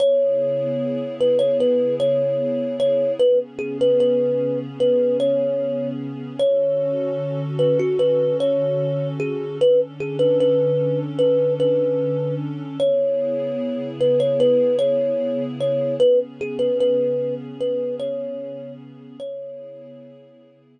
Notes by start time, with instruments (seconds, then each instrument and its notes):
0.00 pad 2 (warm) C#3 B3 E4 G#4, kalimba C#5
1.21 kalimba B4
1.39 kalimba C#5
1.60 kalimba B4
2.00 kalimba C#5
2.80 kalimba C#5
3.20 pad 2 (warm) C#3 B3 C#4 G#4, kalimba B4
3.59 kalimba G#4
3.81 kalimba B4
4.00 kalimba B4
4.80 kalimba B4
5.20 kalimba C#5
6.39 pad 2 (warm) D3 C#4 F#4 A4, kalimba C#5
7.59 kalimba B4
7.80 kalimba F#4
7.99 kalimba B4
8.40 kalimba C#5
9.20 kalimba G#4
9.60 pad 2 (warm) D3 C#4 D4 A4, kalimba B4
10.00 kalimba G#4
10.19 kalimba B4
10.40 kalimba B4
11.19 kalimba B4
11.60 kalimba B4
12.80 pad 2 (warm) C#3 B3 E4 G#4, kalimba C#5
14.01 kalimba B4
14.20 kalimba C#5
14.40 kalimba B4
14.79 kalimba C#5
15.61 kalimba C#5
16.00 pad 2 (warm) C#3 B3 C#4 G#4, kalimba B4
16.41 kalimba G#4
16.59 kalimba B4
16.80 kalimba B4
17.61 kalimba B4
18.00 kalimba C#5
19.19 pad 2 (warm) C#3 B3 E4 G#4, kalimba C#5